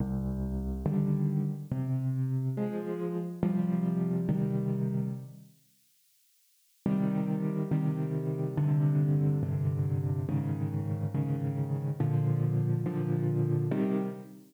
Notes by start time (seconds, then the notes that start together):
0.00 C2
0.86 D3 D#3 G3
1.71 C3
2.57 F3 G#3
3.43 C3 F3 G3
4.29 C3 D#3 G3
6.86 C3 D#3 G3
7.71 C3 D#3 G3
8.57 G2 C3 D3
9.43 G2 C3 D3
10.29 G#2 C#3 D#3
11.14 G#2 C#3 D#3
12.00 A#2 D3 F3
12.86 A#2 D3 F3
13.71 C3 D#3 G3